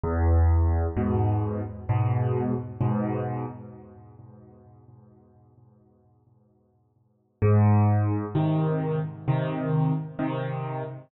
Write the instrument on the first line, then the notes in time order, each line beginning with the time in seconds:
acoustic grand piano
0.03 E2
0.97 G#2 B2
1.89 G#2 B2
2.81 G#2 B2
7.42 G#2
8.35 C3 D#3
9.28 C3 D#3
10.19 C3 D#3